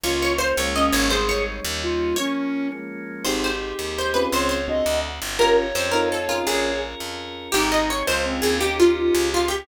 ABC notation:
X:1
M:6/8
L:1/8
Q:3/8=112
K:Ab
V:1 name="Acoustic Guitar (steel)"
d d c d e d | c d5 | d3 z3 | c c3 c =B |
c c5 | B z c B =A F | A2 z4 | G e d c z A |
G F3 F G |]
V:2 name="Flute"
F2 z2 D2 | A2 z2 F2 | D3 z3 | G6 |
d2 e2 z2 | d6 | d2 z4 | E2 z2 C2 |
G5 G |]
V:3 name="Electric Piano 1"
z6 | z6 | z6 | [CEGA]5 [CDFA]- |
[CDFA]2 [C=D^F=A]4 | [DFGB]3 [CEF=A]2 [DF_AB]- | [DFAB]6 | z6 |
z6 |]
V:4 name="Electric Bass (finger)" clef=bass
D,,3 D,,2 A,,,- | A,,,3 E,,3 | z6 | A,,,3 E,,3 |
D,,3 =D,,2 G,,,- | G,,,2 F,,4 | B,,,3 F,,3 | A,,,3 D,,2 E,,- |
E,,3 D,,3 |]
V:5 name="Drawbar Organ"
[B,DF]3 [A,B,DF]3 | [G,A,CE]3 [G,B,DE]3 | [F,B,D]3 [F,A,B,D]3 | [CEGA]6 |
[CDFA]3 [C=D^F=A]3 | [DFGB]3 [CEF=A]3 | [DFAB]6 | [CEGA]3 [DFA]3 |
[DEGB]3 [DFA]3 |]